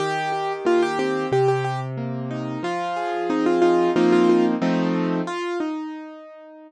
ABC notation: X:1
M:4/4
L:1/16
Q:1/4=91
K:Eb
V:1 name="Acoustic Grand Piano"
G4 F G G2 G G G z5 | F4 E F F2 F F F z5 | F2 E8 z6 |]
V:2 name="Acoustic Grand Piano"
E,2 G2 B,2 C2 C,2 z2 B,2 E2 | F,2 A2 C2 E2 [F,B,CE]4 [F,=A,CE]4 | z16 |]